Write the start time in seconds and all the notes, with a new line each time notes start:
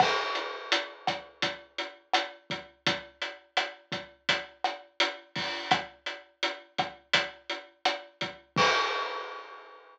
0.00 kick, cross-stick, crash
0.35 closed hi-hat
0.72 closed hi-hat
1.07 kick, cross-stick, closed hi-hat
1.42 kick, closed hi-hat
1.78 closed hi-hat
2.14 cross-stick, closed hi-hat
2.50 kick, closed hi-hat
2.86 kick, closed hi-hat
3.22 closed hi-hat
3.57 cross-stick, closed hi-hat
3.92 kick, closed hi-hat
4.29 kick, closed hi-hat
4.64 cross-stick, closed hi-hat
5.00 closed hi-hat
5.36 kick, open hi-hat
5.71 kick, cross-stick, closed hi-hat
6.06 closed hi-hat
6.43 closed hi-hat
6.78 kick, cross-stick, closed hi-hat
7.13 kick, closed hi-hat
7.50 closed hi-hat
7.85 cross-stick, closed hi-hat
8.21 kick, closed hi-hat
8.56 kick, crash